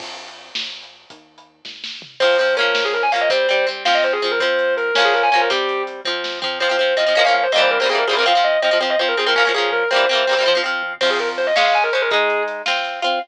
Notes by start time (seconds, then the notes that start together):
0.00 F2, kick, crash
0.28 closed hi-hat
0.55 A#1, snare
0.82 closed hi-hat
1.10 D#2, kick, closed hi-hat
1.38 closed hi-hat
1.65 G#1, kick, snare
1.84 snare
2.02 floor tom
2.20 F2 F3 C4 C5, kick, crash
2.38 F3 C4, closed hi-hat
2.57 F3 A#3 C#4 A#4, closed hi-hat
2.75 A#1, snare
2.84 G#4
2.94 A#4, closed hi-hat
3.03 G#5
3.12 F3 A#3 C#4 F5, closed hi-hat
3.21 D#5
3.30 C2 G3 C4 C5, kick, closed hi-hat
3.49 G3 C4, closed hi-hat
3.67 G3 C4, closed hi-hat
3.85 F2 F3 C4 F5, snare
3.94 D#5
4.03 C5, closed hi-hat
4.13 G#4
4.22 F2 F3 C4 G#4, closed hi-hat
4.31 A#4
4.40 F3 C4 C5, kick, closed hi-hat
4.59 closed hi-hat
4.77 A#4, closed hi-hat
4.94 A#1 A#3 C#4, snare
4.99 F3
5.05 G#4
5.14 A#4, closed hi-hat
5.23 G#5
5.32 C2 F3 A#3 C#4 G#5, closed hi-hat
5.41 A#4
5.50 G3 C4 G4, kick, closed hi-hat
5.69 closed hi-hat
5.87 closed hi-hat
6.05 F2 F3 C4, kick
6.24 snare
6.42 F3 C4, floor tom
6.60 F2 F3 C4 C5
6.69 F3 C4
6.78 F2 F3 C4
6.97 F2 F3 C4 D#5
7.06 F3 C4
7.15 A#1 F3 A#3 C#4
7.25 F3 A#3 C#4 F5
7.34 A#1 F5
7.43 C5
7.52 A#1 G3 A#3 C4 D#5
7.58 E3 C5
7.71 C2 A#4
7.80 G3 A#3 C4 C5
7.85 C2 E3 C4 G#4
7.91 E3 G3 A#3
7.98 A#4
8.07 F2 G3 A#3 C4 G#4
8.13 E3 C4 A#4
8.18 E3 G3 A#3
8.26 F3 C4 F5
8.35 F3 C4
8.44 F2 D#5
8.62 F2 F3 C4 D#5
8.71 F3 C4
8.81 F2 F3 C4 C5
8.90 D#5
8.99 F2 F3 C4 C5
9.08 A#4
9.17 F2 F3 C4 G#4
9.26 F3 C4 A#4
9.35 A#1 A#3 C#4 A#4
9.39 F3
9.45 F3 A#3 C#4
9.54 A#1 F3 A#3 C#4 G#4
9.72 A#1 A#4
9.91 C2 G3 A#3 C4 C5
9.96 E3
10.09 C2 G3 A#3 C4
10.15 E3
10.27 C2 G3 A#3 C4
10.33 E3
10.37 G3 A#3 C4
10.42 F2 E3 C4
10.48 F3
10.55 F3 C4
10.64 F2 F3 C4
10.82 F2
11.01 F2 F3 C4 C5, kick, crash
11.10 G#4
11.19 A#4, closed hi-hat
11.38 C#2 C5, closed hi-hat
11.47 D#5
11.56 G#3 C#4 F5, snare
11.65 F5
11.74 G#5, closed hi-hat
11.83 A#4
11.93 G#3 C#4 C5, closed hi-hat
12.02 A#4
12.11 G#3 D#4 G#4, kick, closed hi-hat
12.30 closed hi-hat
12.48 closed hi-hat
12.66 C4 F4, snare
12.84 closed hi-hat
13.02 C4 F4, closed hi-hat